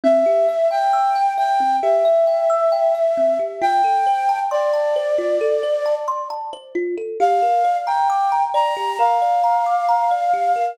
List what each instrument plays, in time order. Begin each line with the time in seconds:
0.04 kalimba C4, flute E5
0.26 kalimba G4
0.49 kalimba E5
0.71 kalimba G5, flute G5
0.93 kalimba E6
1.15 kalimba G5
1.38 kalimba E5, flute G5
1.60 kalimba C4
1.82 kalimba G4, flute E5
2.05 kalimba E5
2.27 kalimba G5
2.50 kalimba E6
2.72 kalimba G5
2.95 kalimba E5
3.17 kalimba C4
3.39 kalimba G4
3.62 kalimba F4, flute G5
3.84 kalimba A4
4.07 kalimba C5
4.29 kalimba A5
4.51 flute D5, kalimba C6
4.74 kalimba A5
4.96 kalimba C5
5.18 kalimba F4
5.41 kalimba A4
5.63 kalimba C5
5.86 kalimba A5
6.08 kalimba C6
6.30 kalimba A5
6.53 kalimba C5
6.75 kalimba F4
6.98 kalimba A4
7.20 kalimba G4, flute F5
7.42 kalimba A#4
7.65 kalimba D5
7.87 flute G5, kalimba A#5
8.10 kalimba D6
8.32 kalimba A#5
8.54 kalimba D5, flute A#5
8.77 kalimba G4
8.99 kalimba A#4, flute F5
9.22 kalimba D5
9.44 kalimba A#5
9.66 kalimba D6
9.89 kalimba A#5
10.11 kalimba D5
10.34 kalimba G4
10.56 kalimba A#4